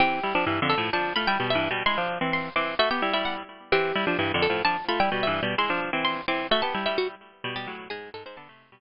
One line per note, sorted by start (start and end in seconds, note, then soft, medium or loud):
0.00 0.20 E3 medium
0.00 0.20 C4 medium
0.00 0.58 G4 loud
0.23 0.33 G3 medium
0.23 0.33 E4 medium
0.35 0.45 F3 medium
0.35 0.45 D4 medium
0.47 0.60 G2 medium
0.47 0.60 E3 medium
0.62 0.75 F2 medium
0.62 0.75 D3 medium
0.70 0.90 A4 loud
0.78 0.90 A2 medium
0.78 0.90 F3 medium
0.93 1.13 F3 medium
0.93 1.13 D4 medium
0.93 1.14 A5 loud
1.16 1.27 A3 medium
1.16 1.27 F4 medium
1.16 1.26 B5 medium
1.27 1.38 G3 medium
1.27 1.38 E4 loud
1.27 1.46 G5 loud
1.40 1.55 B2 medium
1.40 1.55 G3 medium
1.50 1.70 E5 loud
1.55 1.68 G2 medium
1.55 1.68 E3 medium
1.71 1.83 B2 medium
1.71 1.83 G3 medium
1.86 1.97 G#3 medium
1.86 1.97 E4 medium
1.86 2.07 C6 loud
1.98 2.18 F3 medium
1.98 2.18 D4 medium
2.21 2.49 E3 medium
2.21 2.49 C4 medium
2.33 2.54 C6 loud
2.56 2.75 E3 medium
2.56 2.75 C4 medium
2.56 2.77 D6 loud
2.79 2.89 A3 medium
2.79 2.89 F#4 loud
2.79 2.90 E5 loud
2.91 3.02 B3 medium
2.91 3.02 G4 medium
2.91 3.11 G5 loud
3.02 3.13 G3 medium
3.02 3.13 E4 medium
3.13 3.43 G3 medium
3.13 3.43 E4 medium
3.13 3.24 E5 loud
3.25 3.35 F#5 medium
3.72 3.92 E3 medium
3.72 3.92 C4 medium
3.72 4.31 G4 loud
3.95 4.05 G3 medium
3.95 4.05 E4 medium
4.07 4.17 F3 medium
4.07 4.17 D4 medium
4.19 4.32 G2 medium
4.19 4.32 E3 medium
4.34 4.47 F2 medium
4.34 4.47 D3 medium
4.42 4.63 A4 loud
4.50 4.62 A2 medium
4.50 4.62 F3 medium
4.65 4.77 F3 medium
4.65 4.77 D4 medium
4.65 4.85 A5 loud
4.88 4.99 A3 medium
4.88 4.99 F4 medium
4.88 4.99 B5 medium
5.00 5.10 G3 medium
5.00 5.10 E4 loud
5.00 5.19 G5 loud
5.12 5.27 B2 medium
5.12 5.27 G3 medium
5.23 5.43 E5 loud
5.27 5.40 G2 medium
5.27 5.40 E3 medium
5.43 5.55 B2 medium
5.43 5.55 G3 medium
5.58 5.69 G#3 medium
5.58 5.69 E4 medium
5.58 5.80 C6 loud
5.70 5.90 F3 medium
5.70 5.90 D4 medium
5.93 6.21 E3 medium
5.93 6.21 C4 medium
6.05 6.25 C6 loud
6.28 6.47 E3 medium
6.28 6.47 C4 medium
6.28 6.50 D6 loud
6.51 6.61 A3 medium
6.51 6.61 F#4 loud
6.51 6.62 E5 loud
6.62 6.74 B3 medium
6.62 6.74 G4 medium
6.62 6.82 A5 loud
6.74 6.86 G3 medium
6.74 6.86 E4 medium
6.86 7.15 G3 medium
6.86 7.15 E4 medium
6.86 6.97 E5 loud
6.98 7.08 F#4 medium
7.44 7.55 B2 medium
7.44 7.55 G3 loud
7.56 7.67 B2 medium
7.56 7.67 G3 medium
7.56 7.75 G4 medium
7.67 7.88 A2 medium
7.67 7.88 F#3 medium
7.90 8.10 G#2 medium
7.90 8.10 G#3 medium
7.90 8.09 G#4 loud
8.14 8.24 G#2 medium
8.14 8.24 G#3 medium
8.14 8.23 A4 medium
8.26 8.36 G#2 medium
8.26 8.36 G#3 medium
8.26 8.36 C5 medium
8.37 8.48 D3 medium
8.37 8.48 B3 loud
8.37 8.80 A5 loud
8.49 8.70 C3 medium
8.49 8.70 A3 medium
8.72 8.80 B2 medium
8.72 8.80 G3 medium